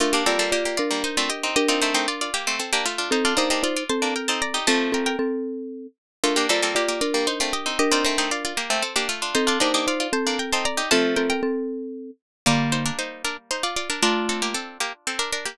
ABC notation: X:1
M:6/8
L:1/16
Q:3/8=77
K:Bb
V:1 name="Harpsichord"
[A,F] [B,G] [CA] [CA] [B,G] [B,G] [Fd]2 [Ec] [Fd] [Ge]2 | [Ge] [Fd] [Ec] [Ec] [Fd] [Fd] [B,G]2 [CA] [B,G] [A,F]2 | [Ec] [Fd] [Ge] [Ge] [Fd] [Fd] [ca]2 [Bg] [ca] [db]2 | [ca]2 [Bg] [Bg]5 z4 |
[A,F] [B,G] [CA] [CA] [B,G] [B,G] [Fd]2 [Ec] [Fd] [Ge]2 | [Ge] [Fd] [Ec] [Ec] [Fd] [Fd] [B,G]2 [CA] [B,G] [A,F]2 | [Ec] [Fd] [Ge] [Ge] [Fd] [Fd] [ca]2 [Bg] [ca] [db]2 | [ca]2 [Bg] [Bg]5 z4 |
[Fd]2 [Ec] [DB] [Ec]2 [DB] z [Ec] [Fd] [Fd] [DB] | [DB]2 [CA] [B,G] [CA]2 [B,G] z [CA] [DB] [DB] [B,G] |]
V:2 name="Marimba"
[DB]2 [Fd]2 [Fd]2 [DB]6 | [DB]6 z6 | [CA]2 [Ec]2 [Ec]2 [CA]6 | [CA]2 [CA]2 [CA]6 z2 |
[DB]2 [Fd]2 [Fd]2 [DB]6 | [DB]6 z6 | [CA]2 [Ec]2 [Ec]2 [CA]6 | [CA]2 [CA]2 [CA]6 z2 |
[D,B,]4 z8 | [A,F]4 z8 |]
V:3 name="Pizzicato Strings"
z [B,D] [G,B,] [G,B,] z3 [G,B,] z [A,C] z [CE] | z [CE] [A,C] [A,C] z3 [A,C] z [B,D] z [DF] | z [DF] [B,D] [B,D] z3 [B,D] z [CE] z [EG] | [F,A,]4 z8 |
z [B,D] [G,B,] [G,B,] z3 [G,B,] z [A,C] z [CE] | z [CE] [A,C] [A,C] z3 [A,C] z [B,D] z [DF] | z [DF] [B,D] [B,D] z3 [B,D] z [CE] z [EG] | [F,A,]4 z8 |
[G,B,]12 | [DF]12 |]